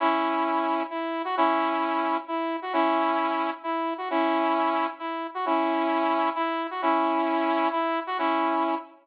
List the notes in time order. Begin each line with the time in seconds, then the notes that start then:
0.00 C#4 E4
0.90 E4
1.25 F#4
1.37 C#4 E4
2.28 E4
2.62 F#4
2.73 C#4 E4
3.63 E4
3.98 F#4
4.10 C#4 E4
4.99 E4
5.34 F#4
5.46 C#4 E4
6.35 E4
6.71 F#4
6.82 C#4 E4
7.72 E4
8.07 F#4
8.18 C#4 E4